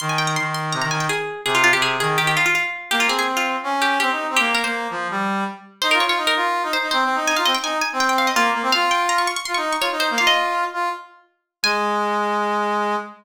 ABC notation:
X:1
M:4/4
L:1/16
Q:1/4=165
K:Ab
V:1 name="Pizzicato Strings"
c' a g b c'2 c'2 b b a g A4 | A F F G A2 A2 G G F F F4 | G F A A z F5 G2 G4 | G2 B c11 z2 |
c B d d z B5 c2 c4 | a f e g a2 a2 g g f e F4 | f2 g2 b d' d' d' c' d'2 d' d2 c2 | f e9 z6 |
a16 |]
V:2 name="Brass Section"
E,4 E,4 C, E, E,2 z4 | C,3 C,3 E,2 E,2 z6 | B,2 C6 D4 C E2 C | B,3 B,3 F,2 G,4 z4 |
(3E2 F2 F2 E2 F3 E z E (3C2 C2 E2 | E F C z E2 z C5 B,2 B, C | F6 z2 F E2 z F E2 B, | F6 F2 z8 |
A,16 |]